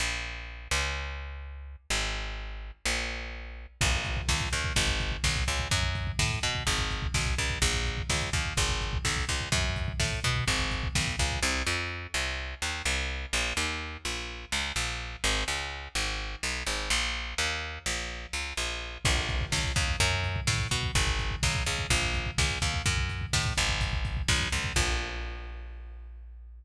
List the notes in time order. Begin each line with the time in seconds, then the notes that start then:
0.00 A#1
0.71 C#2
1.90 G#1
2.86 A#1
3.81 A#1, kick, crash
3.93 kick
4.05 kick, closed hi-hat
4.17 kick
4.29 C#2, kick, snare
4.40 kick
4.52 D#2, kick, closed hi-hat
4.64 kick
4.76 G#1, kick, closed hi-hat
4.88 kick
5.00 kick, closed hi-hat
5.12 kick
5.24 B1, kick, snare
5.36 kick
5.48 C#2, kick, closed hi-hat
5.60 kick
5.71 F#2, kick, closed hi-hat
5.83 kick
5.95 kick, closed hi-hat
6.07 kick
6.19 A2, kick, snare
6.31 kick
6.43 B2, kick, closed hi-hat
6.55 kick
6.67 G#1, kick, closed hi-hat
6.79 kick
6.90 kick, closed hi-hat
7.02 kick
7.14 B1, kick, snare
7.26 kick
7.38 C#2, kick, closed hi-hat
7.50 kick
7.62 A#1, kick, closed hi-hat
7.74 kick
7.86 kick, closed hi-hat
7.98 kick
8.10 C#2, kick, snare
8.21 kick
8.33 D#2, kick, closed hi-hat
8.45 kick
8.57 G#1, kick, closed hi-hat
8.69 kick
8.81 kick, closed hi-hat
8.93 kick
9.05 B1, kick, snare
9.17 kick
9.28 C#2, kick, closed hi-hat
9.41 kick
9.52 F#2, kick, closed hi-hat
9.64 kick
9.76 kick, closed hi-hat
9.88 kick
10.00 A2, kick, snare
10.12 kick
10.24 B2, kick, closed hi-hat
10.36 kick
10.48 G#1, kick, closed hi-hat
10.59 kick
10.71 kick, closed hi-hat
10.83 kick
10.95 B1, kick, snare
11.07 kick
11.19 C#2, kick, closed hi-hat
11.31 kick
11.43 C2
11.67 F2
12.14 C2
12.62 D#2
12.85 C2
13.33 A#1
13.57 D#2
14.05 A#1
14.52 C#2
14.76 A#1
15.24 G#1
15.48 C#2
15.95 G#1
16.43 B1
16.66 G#1
16.90 A#1
17.38 D#2
17.86 A#1
18.33 C#2
18.57 A#1
19.05 A#1, kick, crash
19.17 kick
19.28 kick, closed hi-hat
19.41 kick
19.52 C#2, kick, snare
19.64 kick
19.76 D#2, kick, closed hi-hat
19.88 kick
20.00 F#2, kick, closed hi-hat
20.12 kick
20.24 kick, closed hi-hat
20.36 kick
20.47 A2, kick, snare
20.60 kick
20.71 B2, kick, closed hi-hat
20.83 kick
20.95 G#1, kick, closed hi-hat
21.07 kick
21.19 kick, closed hi-hat
21.31 kick
21.43 B1, kick, snare
21.55 kick
21.66 C#2, kick, closed hi-hat
21.79 kick
21.90 A#1, kick, closed hi-hat
22.02 kick
22.14 kick, closed hi-hat
22.26 kick
22.38 C#2, kick, snare
22.50 kick
22.62 D#2, kick, closed hi-hat
22.74 kick
22.86 F#2, kick, closed hi-hat
22.98 kick
23.10 kick, closed hi-hat
23.21 kick
23.33 A2, kick, snare
23.45 kick
23.57 G#1, kick, closed hi-hat
23.69 kick
23.81 kick, closed hi-hat
23.93 kick
24.05 kick, closed hi-hat
24.17 kick
24.28 B1, kick, snare
24.40 kick
24.52 C#2, kick, open hi-hat
24.64 kick
24.76 A#1, kick, crash